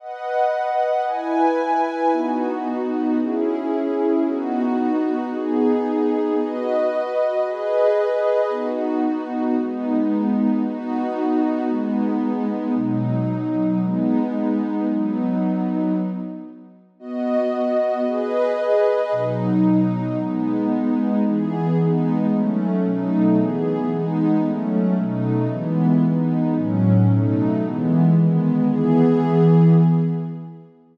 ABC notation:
X:1
M:6/8
L:1/8
Q:3/8=113
K:B
V:1 name="Pad 2 (warm)"
[Bdf]6 | [EBg]6 | [B,DF]6 | [CEG]6 |
[B,DF]6 | [B,DG]6 | [FBd]6 | [GBd]6 |
[B,DF]6 | [G,B,D]6 | [B,DF]6 | [G,B,D]6 |
[B,,F,D]6 | [G,B,D]6 | [F,B,D]6 | z6 |
[B,Fd]6 | [GBd]6 | [B,,F,D]6 | [G,B,D]6 |
[K:E] [E,B,G]3 [G,B,D]3 | [F,A,C]3 [B,,F,A,D]3 | [E,B,G]3 [G,B,D]3 | [F,A,C]3 [B,,F,A,D]3 |
[E,G,B,]3 [G,B,D]3 | [A,,F,C]3 [B,,F,A,D]3 | [E,G,B,]3 [D,G,B,]3 | [E,B,G]6 |]